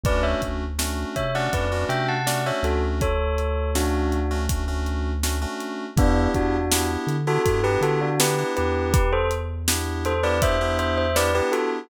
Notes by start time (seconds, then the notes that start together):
0.04 D2 A3 C#4 D4 F#4 B4 D5, kick, closed hi-hat
0.23 C#5 E5
0.42 D2, kick, closed hi-hat
0.79 A3 C#4 D4 F#4, snare
1.16 C3 C#5 E5, kick, closed hi-hat
1.35 A3 C#4 D4 F#4 D5 F#5
1.53 F2 A3 C#4 D4 F#4 B4 D5, kick, closed hi-hat
1.72 A3 C#4 D4 F#4
1.89 C3 E5 G5, closed hi-hat
2.08 F#5 A5
2.27 A3 C#4 D4 F#4 D5 F#5, snare
2.46 A3 C#4 D4 F#4 C#5 E5
2.63 D2 F#4 A4, closed hi-hat
3.01 A4 C#5, kick, closed hi-hat
3.38 closed hi-hat
3.75 A3 C#4 D4 F#4, snare
4.12 closed hi-hat
4.31 A3 C#4 D4 F#4
4.49 A3 C#4 D4 F#4, kick, closed hi-hat
4.68 A3 C#4 D4 F#4
4.86 closed hi-hat
5.23 A3 C#4 D4 F#4, snare
5.42 A3 C#4 D4 F#4
5.60 snare, closed hi-hat
5.96 E2 B3 D4 E4 G4, kick, closed hi-hat
6.34 E2 D4 F#4, kick, closed hi-hat
6.72 B3 D4 E4 G4, snare
7.07 D3, closed hi-hat
7.27 B3 D4 E4 F#4 G4 A4
7.45 G2 B3 D4 E4 F#4 G4 A4, kick, closed hi-hat
7.64 B3 D4 E4 G4 B4
7.81 D3 F#4 A4, closed hi-hat
8.01 D4 F#4
8.20 B3 D4 E4 G4 B4, snare
8.38 B3 D4 E4 G4
8.56 E2 G4 B4, closed hi-hat
8.94 G4 B4, kick, closed hi-hat
9.13 A4 C5
9.31 closed hi-hat
9.68 B3 D4 E4 G4, snare
10.05 A4 C5, closed hi-hat
10.23 B3 D4 E4 G4 B4 D5
10.42 B3 D4 E4 G4 C5 E5, kick, closed hi-hat
10.61 B3 D4 E4 G4
10.79 C5 E5, closed hi-hat
10.98 C5 E5
11.16 B3 D4 E4 G4 B4 D5, snare
11.35 B3 D4 E4 G4 B4
11.52 F#4 A4, closed hi-hat